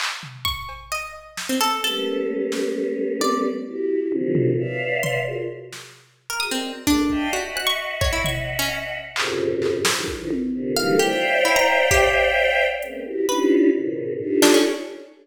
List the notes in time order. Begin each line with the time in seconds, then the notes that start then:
0.00 clap
0.23 floor tom
0.45 C#6, kick
0.69 cowbell
0.92 D#5
1.37 snare
1.49 C4
1.61 A4
1.83 G3 A3 A#3 B3 C#4 A4
2.52 snare
3.21 D5, high tom
3.67 E4 F#4 G4
4.12 A#2 C3 D3 D#3 F3 F#3, high tom
4.35 floor tom
4.58 B4 C#5 D5 E5 F5
5.03 C6, floor tom
5.27 F4 F#4 G#4 A#4
5.73 snare
6.30 A#4
6.40 F#4 G#4 A#4 D#6
6.51 C4 A#4 C5 D5 D#5
6.87 G#3 A3 A#3 D4, kick
7.10 D5 D#5 E5 F5 G5 A5, kick
7.33 F#4 D#5 E5 F#5
7.56 F#6, cowbell
7.67 C#6
8.01 C#5, kick
8.13 E4
8.24 C#6, floor tom
8.59 C#4
9.16 F2 F#2 G#2 A#2 C3 C#3, clap
9.62 clap
9.85 A#4 C5 C#5, snare
9.96 D3 D#3 E3 F3 G3 G#3
10.08 D#4 E4 F4, kick
10.19 D3 D#3 E3 F3
10.31 high tom
10.53 A#2 C3 D3
10.76 D3 D#3 E3 F#3 G3 A3 F5
10.99 G4 C5 C#5 D5 E5 F5 G5
11.45 E4
11.56 A#5
11.91 G4, kick
12.82 G#3 A#3 B3 C4 C#4, closed hi-hat
13.05 E4 F#4 G4
13.29 C#4 D4 D#4 E4 F4 G4 B4
13.73 G#2 A#2 B2 C#3 D#3
14.20 D4 D#4 F4 G4 A4
14.42 D4, snare
14.54 C#4